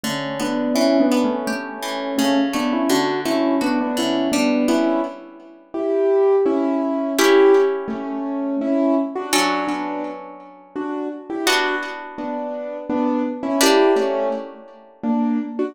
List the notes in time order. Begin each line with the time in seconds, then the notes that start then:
0.03 D3 A3 C#4
0.39 B3 D4
0.75 E3 C#4 E4
1.00 B3 D4
1.11 B3
1.24 A3 C#4
1.47 A3 C#4 G4
1.82 E3
2.18 C#3 A3 C#4
2.53 A3 B3 D4
2.73 C#4 E4
2.89 D3 D4 F#4
3.25 A3 C#4 E4
3.61 B3 D4 F#4
3.81 B3 D4
3.97 D3 C#4 E4
4.32 G3 B3 D4
4.68 B3 C#4 E4
5.74 E4 G4
6.46 C#4 E4
7.18 C#4 E4 G4
7.88 A3 C#4
8.61 C#4 E4
9.15 D4 F#4
9.33 F#3 C#4 D4 F#4 A4
9.67 B3 D4
10.76 D4 F#4
11.30 E4 G4
11.46 B3 D4 F#4
12.18 B3 D4
12.89 B3 D4
13.43 C#4 E4
13.61 A#3 D4 E4 G4
13.96 A3 C#4
15.03 A#3 D4
15.59 D4 F#4